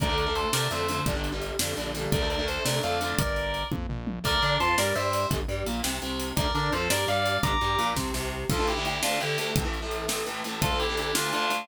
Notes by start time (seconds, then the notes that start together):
0.00 D2 D3 A3 A#4 D5, kick, closed hi-hat
0.09 D3 A3
0.18 A#4 D5, closed hi-hat
0.26 D3 A3
0.35 A4 C5, closed hi-hat
0.53 C3 D3 A3 A#4 D5, snare
0.71 F2 D3 A3 C5 E5, closed hi-hat
0.88 D3 A3, closed hi-hat
1.06 G1 D3 G3, kick, closed hi-hat
1.15 D3 G3
1.24 closed hi-hat
1.32 D3 G3
1.42 closed hi-hat
1.59 F2 D3 G3, snare
1.77 A#1 D3 G3, closed hi-hat
1.94 D3 G3, closed hi-hat
2.12 D2 D3 A3 A#4 D5, kick, closed hi-hat
2.21 D3 A3
2.30 A#4 D5, closed hi-hat
2.39 D3 A3
2.48 A4 C5, closed hi-hat
2.65 C3 D3 A3 A#4 D5, snare
2.83 F2 D3 A3 D5 F5, closed hi-hat
3.01 D3 A3, closed hi-hat
3.19 G1 A#4 D5, kick, closed hi-hat
3.36 closed hi-hat
3.54 closed hi-hat
3.72 F2, kick, high tom
3.89 A#1, floor tom
4.07 mid tom
4.24 D2 D3 A3 A#4 D5, kick, crash
4.42 D3 D4 A#4 D5, closed hi-hat
4.60 F2 F3 A5 C6, closed hi-hat
4.78 G2 G3 A#4 D5, snare
4.95 G2 G3 C5 E5, closed hi-hat
5.13 closed hi-hat
5.30 G1 D3 G3, kick, closed hi-hat
5.48 G2 G3, closed hi-hat
5.66 A#1 A#2, closed hi-hat
5.83 C2 C3, snare
6.02 C2 C3, closed hi-hat
6.20 closed hi-hat
6.37 D2 D3 A3 A#4 D5, kick, closed hi-hat
6.54 D3 D4 A#4 D5, closed hi-hat
6.72 F2 F3 A4 C5, closed hi-hat
6.90 G2 G3 A#4 D5, snare
7.08 G2 G3 D5 F5, closed hi-hat
7.26 closed hi-hat
7.43 G1 D3 G3 A#5 D6, kick, closed hi-hat
7.61 G2 G3, closed hi-hat
7.78 A#1 A#2, closed hi-hat
7.96 C2 C3, kick, snare
8.14 C2 C3, snare
8.50 D2 D3 A3 F4 A4, kick, crash
8.59 D2 D3 A3
8.67 E4 G4, closed hi-hat
8.76 D2 D3 A3
8.85 E4 G4, closed hi-hat
9.02 D2 D3 A3 D4 F4, snare
9.20 D2 D3 A3 E4 G4, closed hi-hat
9.38 D2 D3 A3, closed hi-hat
9.56 A2 E3 A3, kick, closed hi-hat
9.64 A2 E3 A3
9.74 closed hi-hat
9.82 A2 E3 A3
9.91 closed hi-hat
10.08 A2 E3 A3, snare
10.26 A2 E3 A3, closed hi-hat
10.44 A2 E3 A3, closed hi-hat
10.61 D2 D3 A3 F4 A4, kick, closed hi-hat
10.71 D2 D3 A3
10.79 E4 G4, closed hi-hat
10.89 D2 D3 A3
10.97 E4 G4, closed hi-hat
11.15 D2 D3 A3 D4 F4, snare
11.33 D2 D3 A3 D4 F4, closed hi-hat
11.50 D2 D3 A3, closed hi-hat